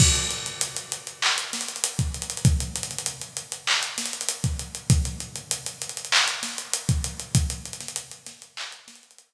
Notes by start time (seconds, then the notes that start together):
0.00 kick, crash
0.15 closed hi-hat
0.30 closed hi-hat
0.46 closed hi-hat
0.61 closed hi-hat
0.76 closed hi-hat
0.92 closed hi-hat
1.07 closed hi-hat
1.22 clap
1.38 closed hi-hat
1.53 snare, closed hi-hat
1.61 closed hi-hat
1.68 closed hi-hat
1.76 closed hi-hat
1.84 closed hi-hat
1.99 kick, closed hi-hat
2.14 closed hi-hat
2.22 closed hi-hat
2.30 closed hi-hat
2.37 closed hi-hat
2.45 kick, closed hi-hat
2.60 closed hi-hat
2.76 closed hi-hat
2.83 closed hi-hat
2.91 closed hi-hat
2.98 closed hi-hat
3.06 closed hi-hat
3.21 closed hi-hat
3.37 closed hi-hat
3.52 closed hi-hat
3.67 clap
3.83 closed hi-hat
3.98 snare, closed hi-hat
4.05 closed hi-hat
4.13 closed hi-hat
4.21 closed hi-hat
4.29 closed hi-hat
4.44 kick, closed hi-hat
4.59 closed hi-hat
4.75 closed hi-hat
4.90 kick, closed hi-hat
5.05 closed hi-hat
5.20 closed hi-hat
5.36 closed hi-hat
5.51 closed hi-hat
5.66 closed hi-hat
5.82 closed hi-hat
5.89 closed hi-hat
5.97 closed hi-hat
6.05 closed hi-hat
6.12 clap
6.28 closed hi-hat
6.43 snare, closed hi-hat
6.58 closed hi-hat
6.73 closed hi-hat
6.89 kick, closed hi-hat
7.04 closed hi-hat
7.20 closed hi-hat
7.35 kick, closed hi-hat
7.50 closed hi-hat
7.65 closed hi-hat
7.73 closed hi-hat
7.80 snare, closed hi-hat
7.88 closed hi-hat
7.96 closed hi-hat
8.11 closed hi-hat
8.26 snare, closed hi-hat
8.42 closed hi-hat
8.57 clap
8.72 closed hi-hat
8.88 snare, closed hi-hat
8.95 closed hi-hat
9.03 closed hi-hat
9.11 closed hi-hat
9.18 closed hi-hat